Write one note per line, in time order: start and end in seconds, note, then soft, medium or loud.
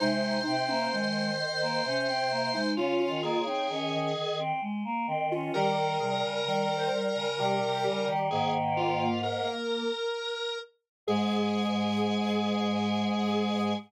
0.00 0.40 C3 loud
0.00 0.38 G#3 medium
0.00 0.55 D#4 medium
0.00 2.71 C5 loud
0.46 0.85 C3 loud
0.46 0.68 C4 medium
0.68 0.91 A#3 medium
0.68 0.90 C#4 medium
0.92 1.81 D#3 loud
0.92 1.30 G#3 medium
1.62 1.84 A#3 medium
1.85 2.59 C3 loud
1.85 2.07 C#4 medium
2.08 2.30 C4 medium
2.31 2.53 A#3 medium
2.54 2.76 G#3 medium
2.54 2.76 D#4 medium
2.77 3.06 C#3 loud
2.77 3.17 C#4 medium
2.77 3.42 F4 medium
2.77 2.99 F4 medium
3.00 3.22 F4 medium
3.08 3.38 D#3 loud
3.23 3.45 A#3 medium
3.23 4.38 G#4 medium
3.38 3.67 C#3 medium
3.46 3.68 C4 medium
3.46 3.68 D#4 medium
3.69 3.92 D#3 loud
3.69 4.08 C#4 medium
3.92 4.14 D#3 loud
4.15 4.52 D#3 loud
4.39 4.61 C4 medium
4.62 4.83 G#3 medium
4.85 5.07 A#3 medium
5.07 5.50 D#3 loud
5.07 5.29 C4 medium
5.31 5.53 C#4 medium
5.31 5.53 F4 medium
5.54 5.98 D#3 medium
5.54 5.97 G3 loud
5.54 5.76 G4 medium
5.54 8.08 A#4 loud
6.00 6.22 C3 medium
6.00 6.40 G3 loud
6.00 6.22 G#4 medium
6.23 6.45 C#3 medium
6.46 6.88 D#3 medium
6.46 7.26 G3 loud
6.46 6.77 A#4 medium
6.76 7.05 C5 medium
7.08 7.37 A#4 medium
7.15 7.37 C#3 medium
7.38 7.60 C3 medium
7.38 8.29 G3 loud
7.38 8.27 G4 medium
7.61 7.83 C3 medium
7.85 8.07 C#3 medium
8.08 8.30 D#3 medium
8.30 9.47 G#2 loud
8.30 9.08 D#3 medium
8.30 9.83 A#3 medium
8.30 8.53 G#4 medium
8.77 9.21 F4 medium
9.23 10.58 A#4 medium
11.07 13.73 G#2 loud
11.07 13.74 G#3 loud
11.07 13.73 G#4 loud
11.07 13.74 G#4 loud